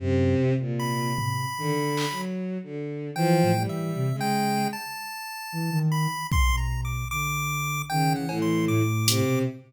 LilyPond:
<<
  \new Staff \with { instrumentName = "Ocarina" } { \clef bass \time 6/4 \tempo 4 = 76 ges,8 c4. ees16 r4. r16 \tuplet 3/2 { e8 a,8 e8 } c16 des8. | r4 e16 ees8 r8 b,8. d4 \tuplet 3/2 { ees8 e8 e8 } a,8. b,16 | }
  \new Staff \with { instrumentName = "Lead 1 (square)" } { \time 6/4 r4 b''2 r4 \tuplet 3/2 { g''4 e''4 g''4 } | a''4. b''8 \tuplet 3/2 { c'''8 bes''8 d'''8 } d'''4 \tuplet 3/2 { g''8 ges''8 c'''8 } d'''4 | }
  \new Staff \with { instrumentName = "Violin" } { \clef bass \time 6/4 c8. bes,8. r8 \tuplet 3/2 { d4 ges4 d4 } f8 g8. aes8. | r1 des8 a,8. r16 c8 | }
  \new DrumStaff \with { instrumentName = "Drums" } \drummode { \time 6/4 r4 r8 tomfh8 r8 hc8 r4 r4 r4 | r4 r4 bd4 r4 r8 cb8 r8 hh8 | }
>>